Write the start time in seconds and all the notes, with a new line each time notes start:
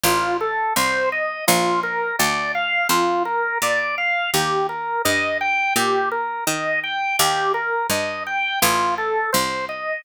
0.03 A1 F4
0.41 A4
0.76 C2 C5
1.12 D#5
1.47 A#1 F4
1.83 A#4
2.19 D2 D5
2.55 F5
2.89 F2 F4
3.25 A#4
3.62 A#2 D5
3.98 F5
4.34 D#2 G4
4.69 A#4
5.05 G2 D#5
5.41 G5
5.76 A#2 G4
6.11 A#4
6.47 D#3 D#5
6.83 G5
7.19 D#2 G4
7.54 A#4
7.90 G2 D#5
8.26 G5
8.62 A1 F4
8.98 A4
9.33 C2 C5
9.69 D#5